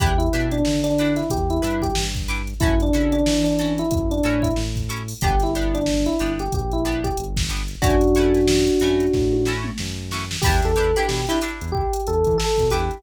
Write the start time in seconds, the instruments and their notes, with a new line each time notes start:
0.00 synth bass 1 E2, pizzicato strings D4 E4 G4 B4, electric piano 1 G4, kick, closed hi-hat
0.18 electric piano 1 E4, closed hi-hat
0.33 synth bass 1 B2, pizzicato strings D4 E4 G4 B4, closed hi-hat
0.51 electric piano 1 D4, closed hi-hat
0.65 synth bass 1 D3, snare
0.84 electric piano 1 D4, closed hi-hat
0.98 pizzicato strings D4 E4 G4 B4, closed hi-hat
1.16 electric piano 1 E4, snare, closed hi-hat
1.30 synth bass 1 E2, electric piano 1 G4, kick, closed hi-hat
1.50 electric piano 1 E4, closed hi-hat
1.62 synth bass 1 G2, pizzicato strings D4 E4 G4 B4, closed hi-hat
1.82 electric piano 1 G4, kick, closed hi-hat
1.95 synth bass 1 G2, snare
2.15 kick, closed hi-hat
2.28 pizzicato strings D4 E4 G4 B4, closed hi-hat
2.47 closed hi-hat
2.60 synth bass 1 F#2, pizzicato strings C#4 E4 F#4 A4, electric piano 1 E4, kick, closed hi-hat
2.80 electric piano 1 D4, closed hi-hat
2.93 synth bass 1 C#3, pizzicato strings C#4 E4 F#4 A4, closed hi-hat
3.12 electric piano 1 D4, closed hi-hat
3.26 synth bass 1 E3, snare
3.44 electric piano 1 D4, closed hi-hat
3.59 pizzicato strings C#4 E4 F#4 A4, closed hi-hat
3.78 electric piano 1 E4, closed hi-hat
3.91 synth bass 1 F#2, electric piano 1 E4, kick, closed hi-hat
4.11 electric piano 1 D4, closed hi-hat
4.23 synth bass 1 A2, pizzicato strings C#4 E4 F#4 A4, closed hi-hat
4.42 electric piano 1 E4, kick, closed hi-hat
4.56 synth bass 1 A2, snare
4.76 kick, closed hi-hat
4.89 pizzicato strings C#4 E4 F#4 A4, closed hi-hat
5.08 open hi-hat
5.21 synth bass 1 G1, pizzicato strings B3 D4 G4, electric piano 1 G4, kick, closed hi-hat
5.40 electric piano 1 E4, snare, closed hi-hat
5.55 pizzicato strings B3 D4 G4, closed hi-hat
5.75 electric piano 1 D4, closed hi-hat
5.86 snare
6.06 electric piano 1 E4, closed hi-hat
6.19 synth bass 1 G1, pizzicato strings B3 D4 G4, closed hi-hat
6.39 electric piano 1 G4, closed hi-hat
6.52 synth bass 1 A#1, electric piano 1 G4, kick, closed hi-hat
6.71 electric piano 1 E4, closed hi-hat
6.85 pizzicato strings B3 D4 G4, closed hi-hat
7.04 electric piano 1 G4, kick, closed hi-hat
7.17 synth bass 1 G1, closed hi-hat
7.37 kick, snare
7.49 pizzicato strings B3 D4 G4, snare, closed hi-hat
7.68 closed hi-hat
7.82 synth bass 1 F#2, pizzicato strings A3 C#4 E4 F#4, electric piano 1 D4 F#4, kick, closed hi-hat
8.01 closed hi-hat
8.15 pizzicato strings A3 C#4 E4 F#4, closed hi-hat
8.34 snare, closed hi-hat
8.48 snare
8.67 closed hi-hat
8.80 synth bass 1 F#2, pizzicato strings A3 C#4 E4 F#4, closed hi-hat
9.00 closed hi-hat
9.13 synth bass 1 A2, kick, snare
9.33 high tom
9.45 pizzicato strings A3 C#4 E4 F#4, snare
9.64 mid tom
9.78 synth bass 1 F#2, snare
10.11 pizzicato strings A3 C#4 E4 F#4, snare
10.31 snare
10.42 synth bass 1 E2, pizzicato strings E4 G4 B4, electric piano 1 G4, kick, crash
10.46 pizzicato strings D4
10.62 synth bass 1 E2, electric piano 1 A4, snare, closed hi-hat
10.76 synth bass 1 E2, pizzicato strings D4 E4 G4 B4, closed hi-hat
10.96 pizzicato strings D4 E4 G4 B4, electric piano 1 G4, closed hi-hat
11.08 synth bass 1 B2, electric piano 1 G4, snare
11.27 pizzicato strings D4 E4 G4 B4, electric piano 1 E4, closed hi-hat
11.41 pizzicato strings D4 E4 G4 B4, closed hi-hat
11.61 synth bass 1 E2, closed hi-hat
11.72 electric piano 1 G4, kick
11.93 closed hi-hat
12.07 synth bass 1 E2, electric piano 1 A4, closed hi-hat
12.24 synth bass 1 E3, kick, closed hi-hat
12.38 electric piano 1 A4, snare
12.58 synth bass 1 B2, kick, snare, closed hi-hat
12.70 synth bass 1 E2, pizzicato strings D4 E4 G4 B4, electric piano 1 G4, closed hi-hat
12.91 closed hi-hat